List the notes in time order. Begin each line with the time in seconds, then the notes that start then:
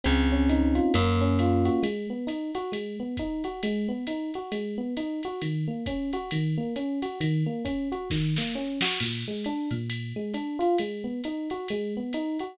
0.04 C#2 C4, ride
0.31 C#4
0.49 D#4, hi-hat pedal, ride
0.75 F4, ride
0.94 F#2 A#3, kick, ride
1.21 C#4
1.39 F4, hi-hat pedal, ride
1.65 F#4, ride
1.83 G#3, ride
2.10 B3
2.27 D#4, hi-hat pedal, ride
2.54 F#4, ride
2.72 G#3, ride
2.99 B3
3.17 D#4, kick, hi-hat pedal, ride
3.44 F#4, ride
3.63 G#3, ride
3.88 B3
4.07 D#4, hi-hat pedal, ride
4.34 F#4, ride
4.52 G#3, ride
4.78 B3
4.97 D#4, hi-hat pedal, ride
5.23 F#4, ride
5.42 D#3, ride
5.67 A#3
5.86 C#4, kick, hi-hat pedal, ride
6.13 F#4, ride
6.31 D#3, ride
6.57 A#3
6.76 C#4, hi-hat pedal, ride
7.02 F#4, ride
7.20 D#3, ride
7.46 A#3
7.65 C#4, kick, hi-hat pedal, ride
7.92 F#4, ride
8.10 D#3, kick, snare
8.36 A#3, snare
8.55 C#4
8.81 F#4, snare
9.00 A#2, crash, ride
9.27 G#3
9.44 D4, hi-hat pedal, ride
9.71 A#2, ride
9.90 ride
10.16 G#3
10.34 D4, hi-hat pedal, ride
10.59 F4, ride
10.78 G#3, ride
11.04 B3
11.24 D#4, hi-hat pedal, ride
11.50 F#4, ride
11.68 G#3, ride
11.96 B3
12.13 D#4, hi-hat pedal, ride
12.39 F#4, ride